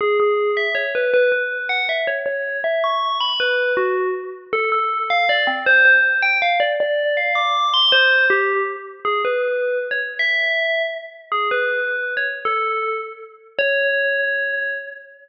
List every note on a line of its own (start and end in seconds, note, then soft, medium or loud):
0.01 0.17 G#4 medium
0.20 0.53 G#4 medium
0.57 0.75 E5 medium
0.75 0.90 C#5 medium
0.95 1.11 B4 medium
1.14 1.31 B4 medium
1.32 1.66 B4 medium
1.69 1.85 F#5 medium
1.89 2.06 E5 medium
2.07 2.22 C#5 medium
2.26 2.58 C#5 medium
2.64 2.82 E5 medium
2.84 3.17 C#6 medium
3.21 3.39 B5 medium
3.40 3.72 B4 medium
3.77 4.08 F#4 medium
4.53 4.69 A4 medium
4.72 5.06 A4 medium
5.10 5.28 F5 medium
5.29 5.45 D5 medium
5.47 5.63 C4 medium
5.66 5.84 C5 loud
5.85 6.19 C5 medium
6.22 6.38 G5 medium
6.42 6.58 F5 medium
6.60 6.75 D5 medium
6.80 7.12 D5 loud
7.17 7.35 F5 medium
7.35 7.69 D6 medium
7.74 7.92 C6 medium
7.92 8.25 C5 medium
8.30 8.61 G4 medium
9.05 9.21 G#4 medium
9.25 9.79 B4 medium
9.91 10.00 C#5 medium
10.19 10.81 E5 medium
11.32 11.48 G#4 medium
11.51 12.12 B4 medium
12.17 12.26 C#5 medium
12.45 12.94 A4 medium
13.59 14.72 C#5 loud